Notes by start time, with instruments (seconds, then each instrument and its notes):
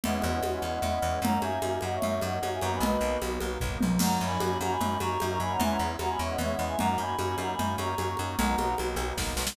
0.03 electric bass (finger) E2, drawbar organ G#3 B3 C#4 E4, choir aahs D#5 F#5, low conga
0.14 choir aahs D#5 F#5
0.22 electric bass (finger) E2, high conga
0.32 choir aahs D#5 F#5
0.42 electric bass (finger) E2, drawbar organ G#3 B3 C#4 E4, high conga
0.53 choir aahs D#5 F#5
0.62 electric bass (finger) E2, choir aahs D#5 F#5
0.72 choir aahs D#5 F#5
0.82 electric bass (finger) E2, drawbar organ G#3 B3 C#4 E4, choir aahs D#5 F#5, low conga
0.93 choir aahs D#5 F#5
1.02 electric bass (finger) E2
1.22 electric bass (finger) F#2, drawbar organ F#3 A#3 C#4 D#4, choir aahs F#5 A#5, low conga
1.41 electric bass (finger) F#2, choir aahs E5 G#5, high conga
1.62 electric bass (finger) F#2, drawbar organ F#3 A#3 C#4 D#4, high conga
1.81 electric bass (finger) F#2, choir aahs D#5 F#5, high conga
1.93 choir aahs C#5 E5
2.02 electric bass (finger) F#2, drawbar organ F#3 A#3 C#4 D#4, low conga
2.21 electric bass (finger) F#2, choir aahs D#5 F#5, high conga
2.42 electric bass (finger) F#2, drawbar organ F#3 A#3 C#4 D#4, high conga
2.52 choir aahs E5 G#5
2.61 electric bass (finger) F#2, drawbar organ F#3 A#3 B3 D#4, choir aahs F#5 A#5, high conga
2.72 choir aahs G#5 B5
2.80 electric bass (finger) B1, choir aahs B4 D#5, low conga
3.01 electric bass (finger) B1
3.22 electric bass (finger) B1, drawbar organ F#3 A#3 B3 D#4, high conga
3.40 electric bass (finger) B1, high conga
3.60 electric bass (finger) B1, drawbar organ F#3 A#3 B3 D#4, kick, floor tom
3.81 electric bass (finger) B1, high tom
3.99 electric bass (finger) F#2, drawbar organ F#3 A#3 C#4 D#4, choir aahs F#5 A#5, crash, low conga
4.21 electric bass (finger) F#2, choir aahs G#5 B5
4.39 electric bass (finger) F#2, drawbar organ F#3 A#3 C#4 D#4, high conga
4.61 electric bass (finger) F#2, choir aahs F#5 A#5, high conga
4.70 choir aahs G#5 B5
4.80 electric bass (finger) F#2, drawbar organ F#3 A#3 C#4 D#4, low conga
4.99 electric bass (finger) F#2, choir aahs A#5 C#6, high conga
5.20 electric bass (finger) F#2, drawbar organ F#3 A#3 C#4 D#4, high conga
5.29 choir aahs A#5 C#6
5.40 electric bass (finger) F#2, drawbar organ F#3 A#3 C#4 D#4, choir aahs G#5 B5
5.50 choir aahs F#5 A#5
5.59 electric bass (finger) E2, drawbar organ G#3 B3 C#4 E4, choir aahs E5 G#5, low conga
5.70 choir aahs F#5 A#5
5.79 electric bass (finger) E2
5.99 electric bass (finger) E2, drawbar organ G#3 B3 C#4 E4, choir aahs F#5 A#5, high conga
6.09 choir aahs G#5 B5
6.19 electric bass (finger) E2, choir aahs C#5 E5
6.29 choir aahs D#5 F#5
6.38 electric bass (finger) E2, drawbar organ G#3 B3 C#4 E4, choir aahs C#5 E5, low conga
6.52 choir aahs D#5 F#5
6.59 electric bass (finger) E2
6.65 choir aahs E5 G#5
6.77 electric bass (finger) F#2, drawbar organ F#3 A#3 C#4 D#4, choir aahs F#5 A#5, low conga
6.98 electric bass (finger) F#2, choir aahs G#5 B5
7.19 electric bass (finger) F#2, drawbar organ F#3 A#3 C#4 D#4, high conga
7.38 electric bass (finger) F#2, choir aahs F#5 A#5, high conga
7.50 choir aahs G#5 B5
7.58 electric bass (finger) F#2, drawbar organ F#3 A#3 C#4 D#4, low conga
7.78 electric bass (finger) F#2, choir aahs A#5 C#6, high conga
7.98 electric bass (finger) F#2, drawbar organ F#3 A#3 C#4 D#4, high conga
8.08 choir aahs A#5 C#6
8.17 electric bass (finger) F#2, drawbar organ F#3 A#3 C#4 D#4, choir aahs A#5 C#6, high conga
8.29 choir aahs A#5 C#6
8.39 electric bass (finger) B1, drawbar organ F#3 A#3 B3 D#4, choir aahs F#5 A#5, low conga
8.58 electric bass (finger) B1, high conga
8.78 electric bass (finger) B1, drawbar organ F#3 A#3 B3 D#4, high conga
8.96 electric bass (finger) B1, high conga
9.17 electric bass (finger) B1, drawbar organ F#3 A#3 B3 D#4, kick, snare
9.37 electric bass (finger) B1, snare
9.47 snare